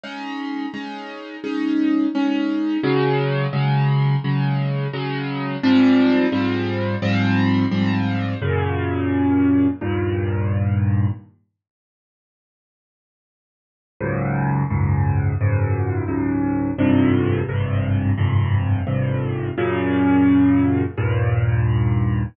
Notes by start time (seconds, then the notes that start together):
0.03 G#3 C#4 D#4
0.74 G#3 C#4 D#4
1.44 G#3 C#4 D#4
2.15 G#3 C#4 D#4
2.83 C#3 F#3 G#3
3.53 C#3 F#3 G#3
4.24 C#3 F#3 G#3
4.93 C#3 F#3 G#3
5.63 G#2 F3 G3 C4
6.32 G#2 F3 G3 C4
7.02 G#2 F3 G3 C4
7.71 G#2 F3 G3 C4
8.42 F#2 A#2 C#3
9.81 D#2 G2 A#2
14.01 C#2 F#2 G#2
14.70 C#2 F#2 G#2
15.41 C#2 F#2 G#2
16.08 C#2 F#2 G#2
16.78 G#1 F2 G2 C3
17.49 G#1 F2 G2 C3
18.18 G#1 F2 G2 C3
18.87 G#1 F2 G2 C3
19.58 F#2 A#2 C#3
20.98 D#2 G2 A#2